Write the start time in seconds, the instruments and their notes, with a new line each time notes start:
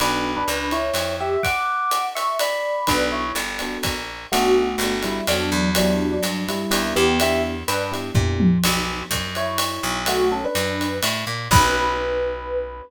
0.00 electric bass (finger) B1, electric piano 1 B3 D4 F#4 A4 B4, ride
0.36 electric piano 1 D4 B4
0.48 electric bass (finger) C#2, hi-hat pedal, ride
0.71 electric piano 1 E4 C#5, ride
0.94 electric bass (finger) F2, ride
1.20 electric piano 1 G4 E5
1.43 electric piano 1 F#5 D6, kick, ride
1.91 hi-hat pedal, ride
2.15 electric piano 1 E5 C#6, ride
2.39 electric piano 1 D5 B5, ride
2.87 electric bass (finger) B1, electric piano 1 B3 D4 F#4 A4 B4, kick, ride
3.12 electric piano 1 E4 C#5
3.35 electric bass (finger) G1, hi-hat pedal, ride
3.59 electric piano 1 B3 D4 F#4 A4, ride
3.83 electric bass (finger) A#1, kick, ride
4.32 electric bass (finger) B1, electric piano 1 A3 B3 D4 F#4 A4, ride
4.78 electric bass (finger) G1, hi-hat pedal, ride
4.83 electric piano 1 B3 D4 F#4 A4
5.03 electric piano 1 G3 E4, ride
5.27 electric bass (finger) F2, electric piano 1 F#3 B3 D4 F#4 A4, ride
5.52 electric bass (finger) E2
5.75 electric piano 1 F#3 B3 D4 E4 G4, ride
6.12 electric piano 1 F#3 D4
6.23 electric bass (finger) G2, hi-hat pedal, ride
6.48 electric piano 1 G3 E4, ride
6.71 electric bass (finger) D#2, electric piano 1 B3 D4 E4 G4, ride
6.96 electric bass (finger) E2, electric piano 1 B3 G4
7.20 electric piano 1 B3 D4 E4 G4 E5, ride
7.68 electric bass (finger) G2, electric piano 1 D4 B4, hi-hat pedal, ride
7.92 electric piano 1 B3 D4 E4 G4, ride
8.15 electric bass (finger) A#2, electric piano 1 B3 D4 E4 G4, kick, floor tom
8.40 high tom
8.63 electric bass (finger) B1, crash, ride
9.11 electric bass (finger) F#2, kick, hi-hat pedal, ride
9.35 electric piano 1 E4 C#5, ride
9.58 ride
9.83 electric bass (finger) B1
10.06 electric piano 1 A3 F#4, ride
10.32 electric piano 1 C#4 A4
10.44 electric piano 1 D4 B4
10.55 electric bass (finger) F#2, hi-hat pedal, ride
10.81 ride
11.03 electric bass (finger) A2, ride
11.27 electric bass (finger) A#2
11.51 electric bass (finger) B1, electric piano 1 B4, kick, crash